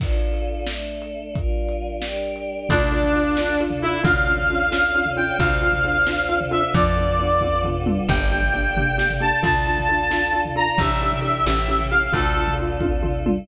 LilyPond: <<
  \new Staff \with { instrumentName = "Brass Section" } { \time 6/8 \key d \minor \tempo 4. = 89 r2. | r2. | d'2~ d'8 e'8 | f''2~ f''8 g''8 |
f''2~ f''8 e''8 | d''2 r4 | g''2~ g''8 a''8 | a''2~ a''8 bes''8 |
e''2~ e''8 f''8 | a'4 r2 | }
  \new Staff \with { instrumentName = "Xylophone" } { \time 6/8 \key d \minor r2. | r2. | <d' f' a'>8 <d' f' a'>8 <d' f' a'>8 <d' f' a'>8 <d' f' a'>8 <d' f' a'>8 | <cis' d' f' a'>8 <cis' d' f' a'>8 <cis' d' f' a'>8 <cis' d' f' a'>8 <cis' d' f' a'>8 <cis' d' f' a'>8 |
<c' d' f' a'>8 <c' d' f' a'>8 <c' d' f' a'>8 <c' d' f' a'>8 <c' d' f' a'>8 <c' d' f' a'>8 | <b d' f' a'>8 <b d' f' a'>8 <b d' f' a'>8 <b d' f' a'>8 <b d' f' a'>8 <b d' f' a'>8 | <bes d' g' a'>8 <bes d' g' a'>8 <bes d' g' a'>8 <bes d' g' a'>8 <bes d' g' a'>8 <bes d' g' a'>8 | <d' f' a'>8 <d' f' a'>8 <d' f' a'>8 <d' f' a'>8 <d' f' a'>8 <d' f' a'>8 |
<d' e' g' a'>8 <d' e' g' a'>8 <d' e' g' a'>8 <cis' e' g' a'>8 <cis' e' g' a'>8 <cis' e' g' a'>8 | <d' f' a'>8 <d' f' a'>8 <d' f' a'>8 <d' f' a'>8 <d' f' a'>8 <d' f' a'>8 | }
  \new Staff \with { instrumentName = "Electric Bass (finger)" } { \clef bass \time 6/8 \key d \minor r2. | r2. | d,2. | d,2. |
d,2. | f,2. | g,,2. | d,2. |
a,,4. a,,4. | d,2. | }
  \new Staff \with { instrumentName = "Choir Aahs" } { \time 6/8 \key d \minor <d' f' a'>4. <a d' a'>4. | <g d' f' bes'>4. <g d' g' bes'>4. | <d' f' a'>2. | <cis' d' f' a'>2. |
<c' d' f' a'>2. | <b d' f' a'>2. | <bes d' g' a'>2. | <d' f' a'>2. |
<d' e' g' a'>4. <cis' e' g' a'>4. | <d' f' a'>2. | }
  \new DrumStaff \with { instrumentName = "Drums" } \drummode { \time 6/8 <cymc bd>8. hh8. sn8. hh8. | <hh bd>8. hh8. sn8. hh8. | <bd tomfh>8. tomfh8. sn8. tomfh8. | <bd tomfh>8. tomfh8. sn8. tomfh8. |
<bd tomfh>8. tomfh8. sn8. tomfh8. | <bd tomfh>8. tomfh8. <bd tommh>8 tomfh8 toml8 | <cymc bd>8. tomfh8. tomfh8 sn16 tomfh8. | <bd tomfh>8. tomfh8. sn8. tomfh8. |
<bd tomfh>8. tomfh8. sn8. tomfh8. | <bd tomfh>8. tomfh8. <bd tommh>8 tomfh8 toml8 | }
>>